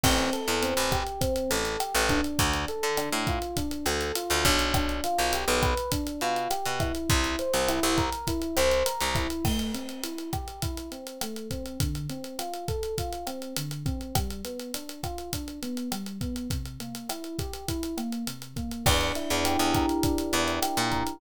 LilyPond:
<<
  \new Staff \with { instrumentName = "Electric Piano 1" } { \time 4/4 \key f \major \tempo 4 = 102 c'8 a'8 c'8 g'8 c'8 a'8 g'8 d'8~ | d'8 a'8 d'8 f'8 d'8 a'8 f'8 d'8 | d'8 f'8 g'8 b'8 d'8 f'8 g'8 e'8~ | e'8 c''8 e'8 bes'8 e'8 c''8 bes'8 e'8 |
a8 c'8 e'8 g'8 e'8 c'8 a8 c'8 | d8 c'8 f'8 a'8 f'8 c'8 d8 c'8 | g8 b8 d'8 f'8 d'8 b8 g8 b8 | c8 bes8 e'8 g'8 e'8 bes8 c8 bes8 |
d'8 e'8 g'8 bes'8 d'8 e'8 g'8 bes'8 | }
  \new Staff \with { instrumentName = "Electric Bass (finger)" } { \clef bass \time 4/4 \key f \major a,,8. e,8 a,,4~ a,,16 a,,8. a,,8. | d,8. d8 a,4~ a,16 d,8. d,16 b,,8~ | b,,8. b,,8 b,,4~ b,,16 b,8. b,8. | c,8. c,8 c,4~ c,16 c,8. c,8. |
r1 | r1 | r1 | r1 |
e,8. e,8 e,4~ e,16 e,8. bes,8. | }
  \new DrumStaff \with { instrumentName = "Drums" } \drummode { \time 4/4 <cymc bd ss>16 hh16 hh16 hh16 hh16 hh16 <hh bd ss>16 hh16 <hh bd>16 hh16 hh16 hh16 <hh ss>16 hh16 <hh bd>16 hh16 | <hh bd>16 hh16 hh16 hh16 <hh ss>16 hh16 <hh bd>16 hh16 <hh bd>16 hh16 <hh ss>16 hh16 hh16 hh16 <hh bd>16 hh16 | <hh bd ss>16 hh16 hh16 hh16 hh16 hh16 <hh bd ss>16 hh16 <hh bd>16 hh16 hh16 hh16 <hh ss>16 hh16 <hh bd>16 hh16 | <hh bd>16 hh16 hh16 hh16 <hh ss>16 hh16 <hh bd>16 hh16 <hh bd>16 hh16 <hh ss>16 hh16 hh16 hh16 <hh bd>16 hh16 |
<cymc bd ss>16 hh16 hh16 hh16 hh16 hh16 <hh bd ss>16 hh16 <hh bd>16 hh16 hh16 hh16 <hh ss>16 hh16 <hh bd>16 hh16 | <hh bd>16 hh16 hh16 hh16 <hh ss>16 hh16 <hh bd>16 hh16 <hh bd>16 hh16 <hh ss>16 hh16 hh16 hh16 <hh bd>16 hh16 | <hh bd ss>16 hh16 hh16 hh16 hh16 hh16 <hh bd ss>16 hh16 <hh bd>16 hh16 hh16 hh16 <hh ss>16 hh16 <hh bd>16 hh16 | <hh bd>16 hh16 hh16 hh16 <hh ss>16 hh16 <hh bd>16 hh16 <hh bd>16 hh16 <hh ss>16 hh16 hh16 hh16 <hh bd>16 hh16 |
<cymc bd ss>16 hh16 hh16 hh16 hh16 hh16 <hh bd ss>16 hh16 <hh bd>16 hh16 hh16 hh16 <hh ss>16 hh16 <hh bd>16 hh16 | }
>>